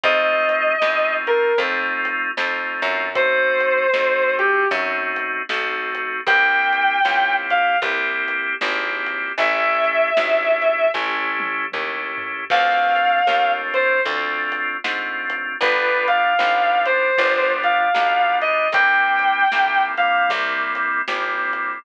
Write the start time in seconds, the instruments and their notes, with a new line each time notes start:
0.03 electric bass (finger) F2, drawbar organ A3 C4 D#4 F4, distortion guitar D#5, kick, closed hi-hat
0.49 closed hi-hat
0.81 electric bass (finger) E2, drawbar organ A3 C4 D#4 F4, snare
1.27 distortion guitar A#4, closed hi-hat
1.58 electric bass (finger) F2, drawbar organ A3 C4 D#4 F4, kick, closed hi-hat
2.05 closed hi-hat
2.37 electric bass (finger) F2, drawbar organ A3 C4 D#4 F4, snare
2.82 electric bass (finger) F#2, closed hi-hat
3.15 drawbar organ A3 C4 D#4 F#4, distortion guitar C5, kick, closed hi-hat
3.60 closed hi-hat
3.94 electric bass (finger) F2, drawbar organ A3 C4 D#4 F#4, snare
4.39 distortion guitar G4, closed hi-hat
4.71 electric bass (finger) F#2, drawbar organ A3 C4 D#4 F#4, kick, closed hi-hat
5.16 closed hi-hat
5.49 electric bass (finger) B1, drawbar organ A3 C4 D#4 F#4, snare
5.95 closed hi-hat
6.26 electric bass (finger) C2, drawbar organ A#3 C4 E4 G4, distortion guitar G5, kick, closed hi-hat
6.73 closed hi-hat
7.05 electric bass (finger) C#2, drawbar organ A#3 C4 E4 G4, snare
7.50 distortion guitar F5, closed hi-hat
7.82 electric bass (finger) C2, drawbar organ A#3 C4 E4 G4, kick, closed hi-hat
8.28 closed hi-hat
8.61 electric bass (finger) G#1, drawbar organ A#3 C4 E4 G4, snare
9.06 closed hi-hat
9.38 electric bass (finger) A1, drawbar organ A3 C#4 E4 G4, distortion guitar E5, kick, closed hi-hat
9.84 closed hi-hat
10.17 electric bass (finger) G#1, drawbar organ A3 C#4 E4 G4, snare
10.62 closed hi-hat
10.94 electric bass (finger) A1, drawbar organ A3 C#4 E4 G4, kick, snare
11.40 high tom
11.72 electric bass (finger) D#2, drawbar organ A3 C#4 E4 G4, mid tom
12.18 floor tom
12.50 electric bass (finger) D2, drawbar organ A3 C4 D4 F4, distortion guitar F5, kick, crash
12.96 closed hi-hat
13.27 electric bass (finger) D#2, drawbar organ A3 C4 D4 F4, snare
13.74 distortion guitar C5, closed hi-hat
14.05 electric bass (finger) D2, drawbar organ A3 C4 D4 F4, kick, closed hi-hat
14.52 closed hi-hat
14.84 electric bass (finger) G#2, drawbar organ A3 C4 D4 F4, snare
15.30 closed hi-hat
15.61 electric bass (finger) G1, drawbar organ G3 B3 D4 F4, distortion guitar B4, kick, closed hi-hat
16.08 distortion guitar F5, closed hi-hat
16.39 electric bass (finger) G#1, drawbar organ G3 B3 D4 F4, snare
16.85 distortion guitar C5, closed hi-hat
17.17 electric bass (finger) G1, drawbar organ G3 B3 D4 F4, kick, closed hi-hat
17.63 distortion guitar F5, closed hi-hat
17.94 electric bass (finger) B1, drawbar organ G3 B3 D4 F4, snare
18.41 distortion guitar D#5, closed hi-hat
18.72 electric bass (finger) C2, drawbar organ G3 A#3 C4 E4, distortion guitar G5, kick, closed hi-hat
19.19 closed hi-hat
19.52 electric bass (finger) B1, drawbar organ G3 A#3 C4 E4, snare
19.97 drawbar organ G3 A#3 C4 E4, distortion guitar F5, closed hi-hat
20.30 electric bass (finger) C2, kick, closed hi-hat
20.75 closed hi-hat
21.08 electric bass (finger) G#1, drawbar organ G3 A#3 C4 E4, snare
21.53 closed hi-hat